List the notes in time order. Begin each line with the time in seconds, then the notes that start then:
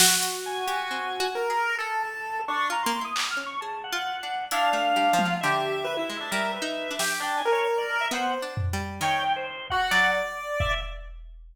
0.00 F#4, snare
0.23 closed hi-hat
0.46 G#5
0.67 G4, closed hi-hat
0.91 C4
1.20 F#4
1.35 A#4
1.50 G#4
1.78 G#4 A4
2.03 A5
2.48 D4 C#6
2.70 F4 A#5
2.83 A#3 C6
3.01 E4 D#6
3.16 D6, clap
3.31 F6
3.37 C#4
3.46 C#6
3.61 G#4 A5
3.84 F#5
3.92 F4
4.23 D4
4.51 D4 E4 F5, closed hi-hat
4.73 A3
4.96 G3
5.13 F3
5.18 F4, high tom
5.25 F#3
5.41 D3 G4 E5
5.84 B4
5.97 E4
6.09 G#3
6.20 D4
6.31 G3 A#4
6.54 B4
6.62 D#4
6.91 D4
6.99 G4, snare
7.20 D4 G5
7.37 G#5
7.45 A#4
7.52 C#5
7.78 D5
7.89 cowbell
8.01 E5
8.11 B3 C5 F#5
8.42 D4
8.57 floor tom
8.73 G3
9.01 D#3 C#5 G5
9.36 C5
9.70 F#4 F#5, kick
9.91 F#3 D5, clap
10.60 E5, kick